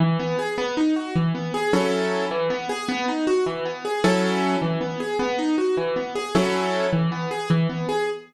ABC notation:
X:1
M:6/8
L:1/8
Q:3/8=104
K:E
V:1 name="Acoustic Grand Piano"
E, B, G B, D F | E, B, G [F,CEA]3 | E, B, G B, D F | E, B, G [F,CEA]3 |
E, B, G B, D F | E, B, G [F,CEA]3 | E, B, G E, B, G |]